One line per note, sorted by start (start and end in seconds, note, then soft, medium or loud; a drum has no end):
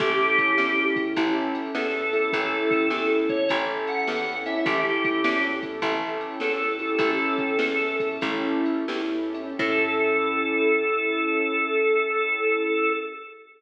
0.00 0.54 A1 medium
0.00 0.55 C#4 medium
0.00 0.55 E4 medium
0.00 0.55 G4 loud
0.00 0.84 G4 medium
0.00 0.55 A4 loud
0.00 kick loud
0.00 crash loud
0.38 kick medium
0.38 ride medium
0.58 1.12 E2 medium
0.58 1.13 C#4 medium
0.58 1.13 E4 medium
0.58 1.13 G4 medium
0.58 1.13 A4 medium
0.58 snare loud
0.96 kick loud
0.96 ride medium
1.16 1.71 A1 medium
1.16 1.71 C#4 loud
1.16 1.71 E4 loud
1.16 1.71 G4 loud
1.16 1.71 A4 loud
1.16 kick loud
1.16 ride loud
1.55 ride medium
1.75 2.29 E2 medium
1.75 2.10 C#4 medium
1.75 2.10 E4 medium
1.75 2.10 G4 medium
1.75 2.10 A4 medium
1.75 2.28 A4 medium
1.75 snare loud
2.13 2.31 C#4 medium
2.13 2.31 E4 medium
2.13 2.31 G4 medium
2.13 2.31 A4 medium
2.13 ride medium
2.33 2.88 A1 loud
2.33 2.88 C#4 loud
2.33 2.88 E4 loud
2.33 2.88 G4 loud
2.33 3.07 A4 medium
2.33 2.88 A4 medium
2.33 kick loud
2.33 ride loud
2.71 kick loud
2.71 ride medium
2.90 3.45 E2 medium
2.90 3.46 C#4 medium
2.90 3.46 E4 medium
2.90 3.46 G4 medium
2.90 3.46 A4 medium
2.90 snare loud
3.29 3.49 C#5 medium
3.29 kick loud
3.29 ride medium
3.49 4.04 A1 loud
3.49 4.05 C#4 loud
3.49 4.05 E4 medium
3.49 4.05 G4 loud
3.49 4.05 A4 loud
3.49 kick medium
3.49 ride loud
3.87 4.36 F#5 medium
3.87 ride medium
4.08 4.62 E2 medium
4.08 4.43 C#4 medium
4.08 4.43 E4 medium
4.08 4.43 G4 medium
4.08 4.43 A4 medium
4.08 snare loud
4.46 4.65 C#4 medium
4.46 4.65 E4 medium
4.46 4.65 G4 medium
4.46 4.65 A4 medium
4.46 4.65 E5 medium
4.46 ride medium
4.66 5.20 A1 loud
4.66 5.21 C#4 medium
4.66 5.21 E4 medium
4.66 5.21 G4 medium
4.66 5.42 G4 medium
4.66 5.21 A4 loud
4.66 kick loud
4.66 ride loud
5.04 kick loud
5.04 ride medium
5.24 5.79 E2 medium
5.24 5.79 C#4 medium
5.24 5.79 E4 medium
5.24 5.79 G4 medium
5.24 5.79 A4 medium
5.24 snare loud
5.63 kick medium
5.63 ride medium
5.82 6.36 A1 loud
5.82 6.38 C#4 loud
5.82 6.38 E4 loud
5.82 6.38 G4 medium
5.82 6.38 A4 loud
5.82 kick loud
5.82 ride loud
6.21 ride medium
6.40 6.96 E2 medium
6.40 6.76 C#4 medium
6.40 6.76 E4 medium
6.40 6.76 G4 medium
6.40 6.76 A4 medium
6.40 6.95 A4 medium
6.40 snare loud
6.79 6.97 C#4 medium
6.79 6.97 E4 medium
6.79 6.97 G4 medium
6.79 6.97 A4 medium
6.79 ride medium
6.99 7.54 A1 medium
6.99 7.55 C#4 loud
6.99 7.55 E4 loud
6.99 7.55 G4 loud
6.99 7.55 A4 loud
6.99 7.96 A4 medium
6.99 kick loud
6.99 ride loud
7.38 kick medium
7.38 ride medium
7.59 8.17 E2 medium
7.59 8.18 C#4 medium
7.59 8.18 E4 medium
7.59 8.18 G4 medium
7.59 8.18 A4 medium
7.59 snare loud
8.00 kick medium
8.00 ride medium
8.21 8.84 A1 loud
8.21 8.84 C#4 loud
8.21 8.84 E4 medium
8.21 8.84 G4 loud
8.21 8.84 A4 loud
8.21 kick loud
8.21 ride loud
8.66 ride medium
8.88 9.54 E2 medium
8.88 9.30 C#4 medium
8.88 9.30 E4 medium
8.88 9.30 G4 medium
8.88 9.30 A4 medium
8.88 snare loud
9.34 9.57 C#4 medium
9.34 9.57 E4 medium
9.34 9.57 G4 medium
9.34 9.57 A4 medium
9.34 ride medium
9.59 12.90 A2 loud
9.59 12.90 C#4 loud
9.59 12.90 E4 loud
9.59 12.90 G4 medium
9.59 12.90 A4 loud
9.59 kick loud
9.59 crash loud